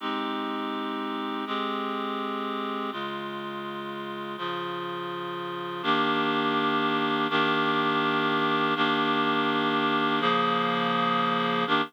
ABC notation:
X:1
M:7/8
L:1/8
Q:1/4=144
K:Abmix
V:1 name="Clarinet"
[A,CE=G]7 | [A,C=GA]7 | [D,A,F]7 | [D,F,F]7 |
[K:Ebmix] [E,B,=DG]7 | [E,B,=DG]7 | [E,B,=DG]7 | [D,F,B,A]7 |
[E,B,=DG]2 z5 |]